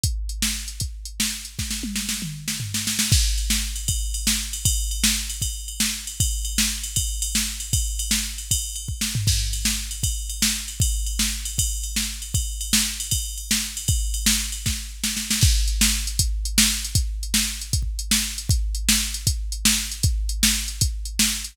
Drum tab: CC |------------------------------------|------------------------------------|x-----------------------------------|------------------------------------|
RD |------------------------------------|------------------------------------|------x--------x--x-----x--------x--|x-----x--------x--x-----x--------x--|
HH |x-----x--------x--x-----x--------x--|------------------------------------|------------------------------------|------------------------------------|
SD |---------o-----------------o--------|o--o-----o--o--------o-----o--o--o--|---------o-----------------o--------|---------o-----------------o--------|
T1 |------------------------------------|------o-----------------------------|------------------------------------|------------------------------------|
T2 |------------------------------------|---------------o--------------------|------------------------------------|------------------------------------|
FT |------------------------------------|------------------------o-----------|------------------------------------|------------------------------------|
BD |o-----------------o-----------------|o-----------------------------------|o-----------------o-----------------|o-----------------o-----------------|

CC |------------------------------------|------------------------------------|x-----------------------------------|------------------------------------|
RD |x-----x--------x--x-----x--------x--|x-----x--------x--x-----x-----------|------x--------x--x-----x--------x--|x-----x--------x--x-----x--------x--|
HH |------------------------------------|------------------------------------|------------------------------------|------------------------------------|
SD |---------o-----------------o--------|---------o--------------------o-----|---------o-----------------o--------|---------o-----------------o--------|
T1 |------------------------------------|------------------------------------|------------------------------------|------------------------------------|
T2 |------------------------------------|------------------------------------|------------------------------------|------------------------------------|
FT |------------------------------------|---------------------------------o--|------------------------------------|------------------------------------|
BD |o-----------------o-----------------|o-----------------o--------o--------|o-----------------o-----------------|o-----------------o-----------------|

CC |------------------------------------|------------------------------------|x-----------------------------------|------------------------------------|
RD |x-----x--------x--x-----x--------x--|x-----x--------x--------------------|------------------------------------|------------------------------------|
HH |------------------------------------|------------------------------------|------x--------x--x-----x--------x--|x-----x--------x--x-----x--------x--|
SD |---------o-----------------o--------|---------o--------o--------o--o--o--|---------o-----------------o--------|---------o-----------------o--------|
T1 |------------------------------------|------------------------------------|------------------------------------|------------------------------------|
T2 |------------------------------------|------------------------------------|------------------------------------|------------------------------------|
FT |------------------------------------|------------------------------------|------------------------------------|------------------------------------|
BD |o-----------------o-----------------|o-----------------o-----------------|o-----------------o-----------------|o-----------------o-o---------------|

CC |------------------------------------|------------------------------------|
RD |------------------------------------|------------------------------------|
HH |x-----x--------x--x-----x--------x--|x-----x--------x--x-----x--------x--|
SD |---------o-----------------o--------|---------o-----------------o--------|
T1 |------------------------------------|------------------------------------|
T2 |------------------------------------|------------------------------------|
FT |------------------------------------|------------------------------------|
BD |o-----------------o-----------------|o-----------------o-----------------|